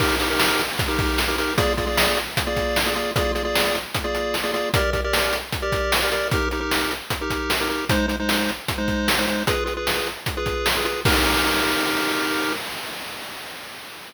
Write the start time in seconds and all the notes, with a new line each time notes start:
0.00 D#4 G4 A#4, kick, crash
0.20 D#4 G4 A#4, closed hi-hat
0.30 D#4 G4 A#4
0.40 snare
0.59 closed hi-hat
0.79 kick, closed hi-hat
0.88 D#4 G4 A#4
0.99 kick, closed hi-hat
1.18 snare
1.28 D#4 G4 A#4
1.38 D#4 G4 A#4, closed hi-hat
1.57 A#3 F4 G#4 D5, kick, closed hi-hat
1.77 A#3 F4 G#4 D5, kick, closed hi-hat
1.87 A#3 F4 G#4 D5
1.97 snare
2.17 closed hi-hat
2.37 kick, closed hi-hat
2.47 A#3 F4 G#4 D5
2.56 kick, closed hi-hat
2.76 snare
2.86 A#3 F4 G#4 D5
2.95 A#3 F4 G#4 D5, closed hi-hat
3.16 A#3 F4 G#4 D5, kick, closed hi-hat
3.35 A#3 F4 G#4 D5, closed hi-hat
3.45 A#3 F4 G#4 D5
3.55 snare
3.75 closed hi-hat
3.94 kick, closed hi-hat
4.04 A#3 F4 G#4 D5
4.15 closed hi-hat
4.34 snare
4.44 A#3 F4 G#4 D5
4.54 A#3 F4 G#4 D5, closed hi-hat
4.74 G4 A#4 D5, kick, closed hi-hat
4.93 G4 A#4 D5, kick, closed hi-hat
5.04 G4 A#4 D5
5.13 snare
5.33 closed hi-hat
5.52 kick, closed hi-hat
5.62 G4 A#4 D5
5.72 kick, closed hi-hat
5.92 snare
6.02 G4 A#4 D5
6.12 G4 A#4 D5, closed hi-hat
6.31 D#4 G4 A#4, kick, closed hi-hat
6.51 D#4 G4 A#4, closed hi-hat
6.60 D#4 G4 A#4
6.71 snare
6.91 closed hi-hat
7.10 kick, closed hi-hat
7.21 D#4 G4 A#4
7.30 kick, closed hi-hat
7.50 snare
7.60 D#4 G4 A#4
7.69 D#4 G4 A#4, closed hi-hat
7.89 G#3 D#4 C5, kick, closed hi-hat
8.08 G#3 D#4 C5, closed hi-hat
8.20 G#3 D#4 C5
8.29 snare
8.49 closed hi-hat
8.68 kick, closed hi-hat
8.78 G#3 D#4 C5
8.88 kick, closed hi-hat
9.08 snare
9.18 G#3 D#4 C5
9.28 G#3 D#4 C5, closed hi-hat
9.47 F4 G#4 B4, kick, closed hi-hat
9.66 F4 G#4 B4, closed hi-hat
9.77 F4 G#4 B4
9.87 snare
10.06 closed hi-hat
10.26 kick, closed hi-hat
10.37 F4 G#4 B4
10.46 kick, closed hi-hat
10.66 snare
10.77 F4 G#4 B4
10.85 F4 G#4 B4, closed hi-hat
11.05 D#4 G4 A#4, kick, crash